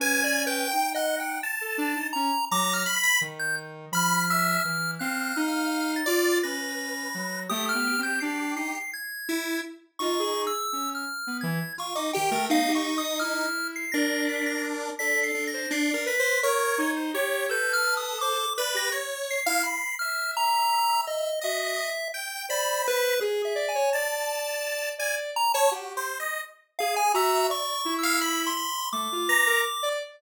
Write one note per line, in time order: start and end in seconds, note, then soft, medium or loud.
0.00 0.64 C#4 medium
0.00 0.22 B4 medium
0.00 0.44 G#5 loud
0.24 0.45 D5 medium
0.47 0.68 B4 medium
0.47 0.90 G5 medium
0.71 1.37 D#4 medium
0.71 0.93 G5 medium
0.94 1.16 D#5 medium
0.94 1.38 F#5 medium
1.20 1.41 G5 medium
1.43 2.07 A5 medium
1.61 1.77 A4 medium
1.78 1.94 D4 loud
1.96 2.12 D#4 medium
2.13 2.31 C#4 medium
2.13 2.45 A#5 loud
2.51 2.83 F#3 medium
2.51 2.83 A#5 medium
2.51 2.73 D6 loud
2.74 2.95 F6 medium
2.86 3.02 B5 loud
2.96 3.18 B6 medium
3.03 3.19 B5 loud
3.21 3.85 D#3 medium
3.39 3.56 G6 medium
3.92 4.56 F3 medium
3.92 4.25 B5 loud
3.92 4.91 F6 medium
4.30 4.62 E5 loud
4.64 4.97 E3 medium
4.99 5.32 C4 loud
4.99 5.97 F5 medium
4.99 5.42 F#6 medium
5.36 6.01 D#4 loud
5.48 5.91 F6 medium
5.96 6.39 A6 medium
6.06 6.39 F4 loud
6.06 6.38 D5 loud
6.43 7.08 C#4 medium
6.43 7.40 B4 medium
6.43 7.40 A#6 medium
7.14 7.47 F#3 medium
7.49 7.72 A3 loud
7.49 8.78 G4 medium
7.49 7.65 D#6 loud
7.69 8.01 F6 loud
7.74 7.96 B3 medium
7.99 8.20 C4 medium
8.03 8.19 G6 medium
8.20 8.54 D4 loud
8.20 8.53 C7 medium
8.56 8.72 D#4 medium
8.56 8.73 C7 medium
8.75 8.91 C7 medium
8.93 9.58 G#6 medium
9.29 9.61 E4 medium
9.99 10.48 D#4 medium
9.99 10.17 F4 medium
9.99 10.42 C#6 medium
10.19 10.51 G#4 loud
10.47 10.90 E6 medium
10.73 11.05 C#4 medium
10.95 11.38 F6 medium
11.27 11.43 B3 medium
11.41 11.59 E3 loud
11.41 11.73 G#6 medium
11.78 11.94 F4 medium
11.78 11.96 C#6 medium
11.95 12.11 D#4 medium
11.95 12.12 D6 medium
12.13 12.32 D#3 medium
12.13 12.31 G4 loud
12.13 12.46 G5 medium
12.31 12.47 A3 loud
12.31 12.48 A#4 medium
12.50 12.67 B3 soft
12.50 13.46 D#4 loud
12.50 12.72 F5 loud
12.68 12.84 G4 medium
12.75 12.97 C#6 medium
12.98 13.19 D#6 medium
13.19 13.85 E4 medium
13.19 13.68 F6 medium
13.76 13.92 C7 medium
13.92 14.90 D4 loud
13.92 14.90 A#4 medium
13.92 14.24 A#6 medium
14.29 14.45 B6 medium
14.46 14.62 A#6 medium
14.99 15.32 D4 medium
14.99 15.48 A4 medium
14.99 15.20 B6 medium
15.23 15.45 C7 medium
15.35 15.67 D4 medium
15.47 15.69 A#6 medium
15.54 15.70 C5 medium
15.71 15.92 D4 loud
15.71 16.04 C7 medium
15.90 16.15 A#4 medium
15.90 16.06 D5 medium
16.06 16.38 B4 loud
16.06 16.39 B6 medium
16.19 16.41 C5 medium
16.43 16.75 A#4 loud
16.43 16.91 C#5 loud
16.78 17.10 D#4 loud
16.96 17.12 C5 medium
17.14 17.46 G4 loud
17.14 17.46 C#5 loud
17.49 18.46 A4 medium
17.49 18.14 B4 medium
17.49 17.72 G6 medium
17.73 17.95 F6 loud
17.97 18.18 D#6 medium
18.21 18.38 C5 medium
18.21 18.53 D6 loud
18.58 18.90 B4 loud
18.58 18.74 D5 medium
18.74 18.90 G4 medium
18.74 18.93 A#6 loud
18.92 19.40 C#5 medium
19.31 19.95 C7 medium
19.46 19.62 E4 medium
19.46 19.62 F5 loud
19.63 19.95 B5 medium
19.99 21.30 E5 medium
19.99 20.31 F6 medium
20.37 21.01 A#5 loud
21.07 21.40 D#5 medium
21.41 21.76 F#4 medium
21.41 21.90 D#5 medium
21.41 22.08 E5 medium
22.14 22.46 G5 medium
22.49 23.13 C5 medium
22.49 22.82 D5 medium
22.49 23.14 B5 medium
22.88 23.20 B4 loud
23.21 23.42 G#4 medium
23.21 23.53 G#4 loud
23.45 23.66 E5 medium
23.55 23.71 D5 loud
23.69 23.90 G#5 medium
23.75 23.91 C#5 loud
23.93 24.91 D5 loud
23.93 24.89 A5 medium
24.98 25.31 D5 loud
24.98 25.15 G#5 medium
25.36 25.52 A#5 loud
25.54 25.70 C#5 loud
25.54 25.70 A5 loud
25.71 25.93 F#4 medium
25.71 26.04 G4 medium
25.97 26.18 C5 medium
26.20 26.41 D#5 medium
26.79 27.12 G#4 medium
26.79 26.95 F5 loud
26.96 27.13 G#5 loud
27.14 27.46 F#4 loud
27.14 27.47 E5 medium
27.14 27.47 A#5 medium
27.50 27.82 D5 medium
27.50 27.94 C#6 loud
27.85 28.49 E4 loud
27.99 28.42 E6 medium
28.03 28.19 F5 loud
28.21 28.53 B5 medium
28.47 28.89 C6 medium
28.57 28.89 B5 medium
28.93 29.09 A3 medium
28.93 29.89 D6 medium
29.12 29.28 F4 medium
29.28 29.44 B4 medium
29.28 29.61 A#5 loud
29.47 29.63 A#4 loud
29.83 29.99 D5 loud